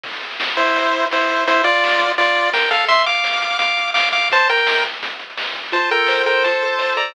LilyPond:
<<
  \new Staff \with { instrumentName = "Lead 1 (square)" } { \time 4/4 \key f \major \tempo 4 = 169 r4. <e' c''>4. <e' c''>4 | <e' c''>8 <f' d''>4. <f' d''>4 <bes' g''>8 <a' f''>8 | <e'' c'''>8 <f'' d'''>4. <f'' d'''>4 <f'' d'''>8 <f'' d'''>8 | <c'' a''>8 <bes' g''>4 r2 r8 |
<c'' a''>8 <bes' g''>4 <bes' g''>8 <c'' a''>4. <d'' bes''>8 | }
  \new Staff \with { instrumentName = "Lead 1 (square)" } { \time 4/4 \key f \major r1 | r1 | r1 | r1 |
f'8 a'8 c''8 a'8 f'8 a'8 c''8 a'8 | }
  \new DrumStaff \with { instrumentName = "Drums" } \drummode { \time 4/4 <cymc bd>16 hh16 hh16 hh16 sn16 hh16 <hh bd>16 hh16 <hh bd>16 hh16 hh16 hh16 sn16 hh16 <hh bd>16 hh16 | <hh bd>16 hh16 hh16 hh16 sn16 hh16 <hh bd>16 hh16 <hh bd>16 hh16 hh16 hh16 sn16 hh16 <hh bd>16 hh16 | <hh bd>16 hh16 hh16 hh16 sn16 hh16 <hh bd>16 hh16 <hh bd>16 hh16 hh16 hh16 sn16 hh16 <hh bd>16 hh16 | <hh bd>16 hh16 hh16 hh16 sn16 hh16 <hh bd>16 hh16 <hh bd>16 hh16 hh16 hh16 sn16 hh16 <hh bd>16 hho16 |
<hh bd>8 hh8 sn8 hh8 <hh bd>8 hh8 sn8 hh8 | }
>>